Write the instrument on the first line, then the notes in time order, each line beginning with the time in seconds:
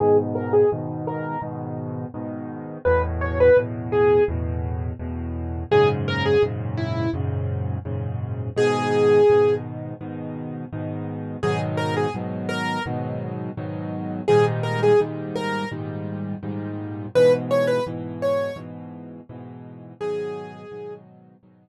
acoustic grand piano
0.00 G#2 B2 D#3 G#4
0.35 A#4
0.53 G#4
0.72 G#2 B2 D#3
1.07 A#4
1.42 G#2 B2 D#3
2.14 G#2 B2 D#3
2.85 E2 A2 B2 B4
3.21 C#5
3.40 B4
3.57 E2 A2 B2
3.92 G#4
4.28 E2 A2 B2
4.99 E2 A2 B2
5.71 F#2 G#2 A#2 C#3 G#4
6.08 A#4
6.26 G#4
6.43 F#2 G#2 A#2 C#3
6.77 E4
7.13 F#2 G#2 A#2 C#3
7.85 F#2 G#2 A#2 C#3
8.56 G#2 B2 D#3 G#4
9.30 G#2 B2 D#3
10.01 G#2 B2 D#3
10.73 G#2 B2 D#3
11.43 G#2 B2 D#3 F#3 G#4
11.77 A#4
11.97 G#4
12.14 G#2 B2 D#3 F#3
12.49 A#4
12.86 G#2 B2 D#3 F#3
13.57 G#2 B2 D#3 F#3
14.28 G#2 A#2 D#3 G3 G#4
14.63 A#4
14.83 G#4
15.00 G#2 A#2 D#3 G3
15.36 A#4
15.71 G#2 A#2 D#3 G3
16.43 G#2 A#2 D#3 G3
17.15 G#2 B2 E3 B4
17.51 C#5
17.67 B4
17.86 G#2 B2 E3
18.22 C#5
18.56 G#2 B2 E3
19.29 G#2 B2 E3
20.01 G#2 B2 D#3 F#3 G#4
20.71 G#2 B2 D#3 F#3
21.43 G#2 B2 D#3 F#3